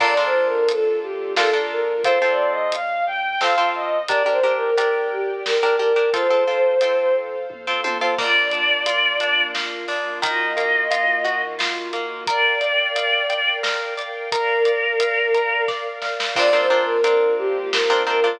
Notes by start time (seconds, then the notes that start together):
0.00 A#1 A#3 D4 F4 A4 A#4 D5, kick, crash
0.17 D4 F4 A4 A#4
0.24 C5
0.34 A#1
0.46 A#4
0.68 A#1 A4, closed hi-hat
1.02 A#1 G4
1.37 A#1 D4 F4 A4 A#4, snare
1.53 D4 F4 A4 A#4
1.70 A#1 A#4
2.04 F2 C4 F4 A4 C5, kick, closed hi-hat
2.22 C4 F4 A4
2.29 D5
2.38 F2
2.50 D#5
2.72 F2 F5, closed hi-hat
3.07 F2 G5
3.41 F2 C4 F4 A4 F5, snare
3.58 C4 F4 A4
3.75 F#2 D#5
4.08 G1 D4 G4 A#4 D5 G5, kick, closed hi-hat
4.26 D4 G4 A#4
4.31 C5
4.43 G1 D4 G4 A#4
4.56 A#4
4.76 G1 D4 G4 A#4, closed hi-hat
5.11 G1 G4
5.45 G1 A#4, snare
5.63 D4 G4 A#4
5.79 G1 D4 G4 A#4
5.96 D4 G4 A#4
6.13 F2 C4 F4 A4 C5 F5, kick, closed hi-hat
6.30 C4 F4 A4
6.47 F2 C4 F4 A4
6.81 F2 C4 F4 A4, closed hi-hat
7.16 F2
7.50 F2, kick, high tom
7.67 C4 F4 A4
7.84 F2 C4 F4 A4, high tom
8.01 C4 F4 A4
8.18 A#3 D4 F4 D5, kick, crash
8.51 D4, closed hi-hat
8.86 F4, closed hi-hat
9.20 D4, closed hi-hat
9.54 A#3, snare
9.88 D4, open hi-hat
10.22 D#3 A#3 F4 F#4 D#5, kick, closed hi-hat
10.57 A#3, closed hi-hat
10.91 F4, closed hi-hat
11.24 F#4, closed hi-hat
11.59 F4, snare
11.93 A#3, closed hi-hat
12.27 A#4 D5 F5 G5, kick, closed hi-hat
12.61 D5, closed hi-hat
12.95 F5, closed hi-hat
13.30 G5, closed hi-hat
13.63 A#4, snare
13.97 D5, closed hi-hat
14.32 A#4 D5 F5, kick, closed hi-hat
14.65 D5, closed hi-hat
15.00 F5, closed hi-hat
15.34 A#4, closed hi-hat
15.68 D5, kick, snare
16.02 F5, snare
16.20 snare
16.36 A#1 A#3 C4 D4 F4 A#4 D5, kick, crash
16.53 C4 D4 F4 A#4
16.59 C5
16.70 A#1 C4 D4 F4 A#4
16.82 A#4
17.04 A#1 C4 D4 F4 A#4, closed hi-hat
17.38 A#1 G4
17.73 A#1 A#4, snare
17.90 C4 D4 F4 A#4
18.07 A#1 C4 D4 F4 A#4
18.24 C4 D4 F4 A#4